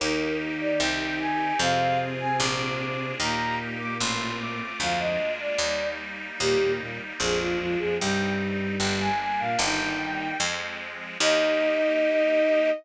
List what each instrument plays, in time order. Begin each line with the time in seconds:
0.00 harpsichord D#2, violin D#3 D#4 A#4, accordion A#3 D#4 G4
0.60 violin D5
0.80 harpsichord C2, accordion C4 D#4 G4, violin G5
1.20 violin G#5
1.59 harpsichord F2, violin C3 C4 F5, accordion C4 F4 G#4
2.20 violin G#5
2.38 harpsichord A#1, accordion A#3 D4 F4 G#4, violin D6
2.79 violin D6
3.19 harpsichord D#2, violin A#2 A#3 A#5, accordion A#3 D#4 G4
3.80 violin D6
3.99 harpsichord A1, accordion A3 C4 F4, violin C6
4.39 violin D6
4.80 harpsichord D2, violin F2 F3 F5, accordion G#3 A#3 D4 F4
4.99 violin D#5
5.40 violin D5
5.58 harpsichord D#2, accordion G3 A#3 D#4
6.39 harpsichord D#2, violin A#2 A#3 G4, accordion G3 A#3 D#4
6.62 violin A#2 A#3
6.79 violin A#2 A#3
7.19 harpsichord A#1, violin F2 F3 G#4, accordion F3 G#3 A#3 D4
7.40 violin F4
7.59 violin F2 F3 F4
7.79 violin F2 F3 G#4
7.99 harpsichord C2, violin G2 G3 G5, accordion G3 C4 D#4
8.79 harpsichord G1, accordion G3 A#3 D4, violin G5
9.00 violin G#5
9.21 violin G#5
9.39 violin A#2 A#3 F5
9.59 harpsichord G1, violin D#3 D#4 G5, accordion G3 A#3 D#4
9.81 violin D#3 D#4
10.39 harpsichord F2, accordion F3 G#3 C4
11.20 harpsichord D#2, accordion A#3 D#4 G4, violin D#4 D#5